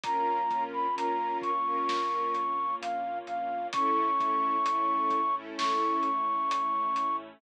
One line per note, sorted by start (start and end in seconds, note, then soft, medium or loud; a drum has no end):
0.04 0.44 A#1 medium
0.04 3.70 A#3 loud
0.04 0.41 C#4 medium
0.04 3.70 C#4 medium
0.04 0.41 F4 medium
0.04 3.70 F4 medium
0.04 0.41 A#4 medium
0.04 0.64 A#5 loud
0.04 kick loud
0.04 closed hi-hat loud
0.50 0.91 A#1 medium
0.50 0.87 C#4 medium
0.50 0.87 F4 medium
0.50 0.87 A#4 medium
0.50 kick medium
0.50 closed hi-hat medium
0.73 0.95 B5 medium
0.96 1.35 A#1 medium
0.96 1.51 C#4 medium
0.96 1.51 F4 medium
0.96 1.51 A#4 medium
0.96 1.38 A#5 medium
0.96 closed hi-hat loud
1.42 1.82 A#1 medium
1.42 2.75 C#6 medium
1.42 kick medium
1.42 closed hi-hat medium
1.66 2.40 C#4 medium
1.66 2.40 F4 medium
1.66 2.40 A#4 medium
1.88 2.28 A#1 medium
1.88 snare loud
2.34 2.74 A#1 medium
2.34 closed hi-hat medium
2.82 3.21 A#1 medium
2.82 3.19 F5 loud
2.82 closed hi-hat loud
3.27 3.67 A#1 medium
3.27 3.68 F5 loud
3.27 closed hi-hat medium
3.73 4.13 A1 medium
3.73 7.40 A3 loud
3.73 4.10 C#4 medium
3.73 7.40 C#4 loud
3.73 4.10 E4 medium
3.73 7.40 E4 medium
3.73 4.10 A4 loud
3.73 5.35 C#6 loud
3.73 kick loud
3.73 closed hi-hat loud
4.19 4.60 A1 medium
4.19 4.56 C#4 medium
4.19 4.56 E4 medium
4.19 4.56 A4 medium
4.19 kick medium
4.19 closed hi-hat medium
4.65 5.05 A1 medium
4.65 5.21 C#4 medium
4.65 5.21 E4 medium
4.65 5.21 A4 medium
4.65 closed hi-hat loud
5.10 5.52 A1 medium
5.10 kick medium
5.10 closed hi-hat medium
5.35 6.09 C#4 medium
5.35 6.09 E4 medium
5.35 6.09 A4 medium
5.58 5.98 A1 medium
5.58 7.16 C#6 loud
5.58 snare loud
6.03 6.44 A1 medium
6.03 closed hi-hat medium
6.49 6.88 A1 medium
6.49 closed hi-hat loud
6.96 7.35 A1 medium
6.96 closed hi-hat loud